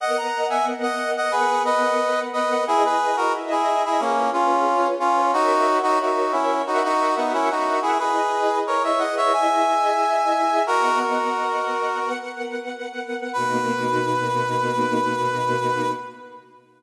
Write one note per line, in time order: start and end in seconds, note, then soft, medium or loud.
0.00 1.32 B3 medium
0.00 1.32 A#4 medium
0.00 1.32 D#5 medium
0.00 0.17 D#5 medium
0.00 1.32 F#5 medium
0.00 0.17 F#5 medium
0.17 0.47 F#5 medium
0.17 0.47 A#5 medium
0.50 0.65 E5 medium
0.50 0.65 G#5 medium
0.83 1.11 D#5 medium
0.83 1.11 F#5 medium
1.17 1.33 D#5 medium
1.17 1.33 F#5 medium
1.32 2.65 B3 medium
1.32 1.63 G#4 medium
1.32 2.65 A#4 medium
1.32 1.63 B4 medium
1.32 2.65 B4 medium
1.32 2.65 F#5 medium
1.65 2.20 B4 medium
1.65 2.20 D#5 medium
2.33 2.64 B4 medium
2.33 2.64 D#5 medium
2.67 3.33 E4 medium
2.67 2.83 E4 medium
2.67 3.33 G#4 medium
2.67 2.83 G#4 loud
2.67 3.33 B4 medium
2.67 3.33 D#5 medium
2.85 3.16 G#4 medium
2.85 3.16 B4 medium
3.17 3.32 F#4 medium
3.17 3.32 A#4 medium
3.33 3.99 E4 medium
3.33 3.99 G#4 medium
3.33 3.99 D#5 loud
3.33 3.99 E5 medium
3.51 3.83 E4 medium
3.51 3.83 G#4 medium
3.85 4.01 E4 medium
3.85 4.01 G#4 medium
4.00 4.30 A#3 medium
4.00 4.66 C#4 medium
4.00 4.30 C#4 medium
4.00 4.66 F4 medium
4.00 4.66 G#4 medium
4.00 4.66 B4 medium
4.33 4.88 C#4 medium
4.33 4.88 F4 medium
4.67 5.33 C#4 medium
4.67 5.33 F4 medium
4.67 5.33 B4 medium
4.67 5.33 C#5 medium
5.00 5.32 C#4 medium
5.00 5.32 F4 medium
5.33 5.78 D#4 medium
5.33 6.65 F#4 medium
5.33 5.78 F#4 loud
5.33 6.65 A#4 medium
5.33 6.65 C#5 medium
5.33 6.65 E5 medium
5.83 5.99 D#4 medium
5.83 5.99 F#4 loud
6.01 6.32 D#4 medium
6.01 6.32 F#4 medium
6.32 6.62 C#4 medium
6.32 6.62 E4 medium
6.67 6.83 D#4 medium
6.67 7.99 F#4 medium
6.67 6.83 F#4 medium
6.67 7.99 A#4 medium
6.67 7.99 E5 medium
6.67 7.99 F#5 medium
6.84 7.14 D#4 medium
6.84 7.14 F#4 medium
7.17 7.33 B3 medium
7.17 7.33 D#4 medium
7.33 7.49 C#4 medium
7.33 7.49 E4 medium
7.50 7.79 D#4 medium
7.50 7.79 F#4 medium
7.82 7.98 E4 medium
7.82 7.98 G#4 medium
7.99 9.32 E4 medium
7.99 8.59 G#4 medium
7.99 9.32 G#4 medium
7.99 8.59 B4 medium
7.99 9.32 B4 medium
7.99 9.32 D#5 medium
8.67 8.83 A#4 medium
8.67 8.83 C#5 medium
8.84 9.00 C#5 medium
8.84 9.00 E5 medium
8.99 9.15 D#5 medium
8.99 9.15 F#5 medium
9.17 9.33 C#5 medium
9.17 9.32 E5 medium
9.33 10.65 E4 medium
9.33 10.65 G#4 medium
9.33 10.65 D#5 medium
9.33 10.62 E5 medium
9.33 10.65 E5 medium
9.33 10.62 G#5 medium
10.67 11.99 B3 medium
10.67 10.99 F#4 medium
10.67 10.99 A#4 loud
10.67 11.99 A#4 medium
10.67 11.99 D#5 medium
10.67 11.99 F#5 medium
11.00 12.09 F#4 medium
11.00 12.09 A#4 medium
12.00 13.32 B3 medium
12.00 13.32 A#4 medium
12.00 13.32 B4 medium
12.00 13.32 F#5 medium
13.33 15.91 B2 loud
13.33 15.91 A#3 loud
13.33 15.91 D#4 medium
13.33 15.91 F#4 loud
13.33 15.91 B4 loud